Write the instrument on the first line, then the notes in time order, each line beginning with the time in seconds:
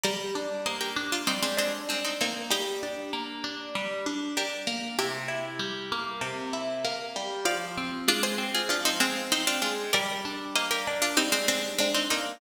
pizzicato strings
0.03 G3 A#4 D5
0.35 D4
0.66 A#3 C5 D#5
0.81 G4 A#4
0.96 D4
1.12 D4 F4
1.27 G3 C4 D#4
1.42 G#3 C4
1.57 G#3 C4 D4
1.89 G#3 C4 D4
2.04 C4 D#4
2.21 A#3 C4 D#4
2.50 G3 D#4 G4
2.83 D4
3.13 A#3
3.44 D4
3.75 G3
4.06 D4
4.37 D4 G4 A#4
4.67 A#3
4.99 C3 E4 G4
5.28 E4
5.59 G3
5.92 A#3
6.21 C3
6.53 E4
6.85 A#3
7.16 G3
7.45 F3 D5 F5
7.77 C4
8.08 G#3 D4 F4
8.23 G#4 C5
8.38 C4
8.54 F4 G#4
8.69 F3 D4 F4
8.85 C4 D#4
9.00 G#3 C4
9.32 C4 D#4
9.47 D4 F4
9.62 G#3 D4 F4
9.93 G3 A#4 D5
10.25 D4
10.55 A#3 C5 D#5
10.71 G4 A#4
10.87 D4
11.02 D4 F4
11.17 G3 C4 D#4
11.32 G#3 C4
11.48 G#3 C4 D4
11.78 G#3 C4 D4
11.94 C4 D#4
12.10 A#3 C4 D#4